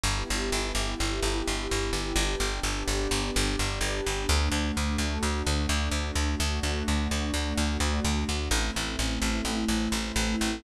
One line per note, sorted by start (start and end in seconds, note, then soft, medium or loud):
0.04 0.24 G1 medium
0.04 2.15 B3 medium
0.04 2.15 E4 medium
0.04 2.15 G4 medium
0.30 0.50 G1 medium
0.52 0.72 G1 medium
0.75 0.95 G1 medium
1.00 1.20 G1 medium
1.23 1.43 G1 medium
1.48 1.68 G1 medium
1.71 1.91 G1 medium
1.93 2.13 G1 medium
2.16 2.36 G1 medium
2.16 4.26 B3 medium
2.16 4.26 D4 loud
2.16 4.26 G4 loud
2.40 2.60 G1 medium
2.63 2.83 G1 medium
2.88 3.08 G1 medium
3.11 3.31 G1 medium
3.36 3.56 G1 medium
3.59 3.79 G1 medium
3.81 4.01 G1 medium
4.06 4.26 G1 medium
4.29 4.49 D2 loud
4.29 6.39 A3 loud
4.29 6.39 D4 medium
4.29 6.39 F#4 medium
4.52 4.72 D2 medium
4.77 4.97 D2 medium
4.98 5.18 D2 medium
5.23 5.43 D2 medium
5.47 5.67 D2 medium
5.69 5.89 D2 medium
5.91 6.11 D2 medium
6.15 6.35 D2 medium
6.40 6.60 D2 medium
6.40 8.51 A3 medium
6.40 8.51 D4 medium
6.40 8.51 F#4 loud
6.63 6.83 D2 medium
6.88 7.08 D2 medium
7.11 7.31 D2 medium
7.34 7.54 D2 medium
7.58 7.78 D2 medium
7.80 8.00 D2 medium
8.05 8.25 D2 medium
8.29 8.49 D2 medium
8.51 8.71 A1 medium
8.51 10.62 A3 loud
8.51 10.62 C4 loud
8.51 10.62 E4 medium
8.76 8.96 A1 medium
8.99 9.19 A1 medium
9.22 9.42 A1 medium
9.45 9.65 A1 medium
9.69 9.89 A1 medium
9.92 10.12 A1 medium
10.16 10.36 A1 medium
10.41 10.61 A1 medium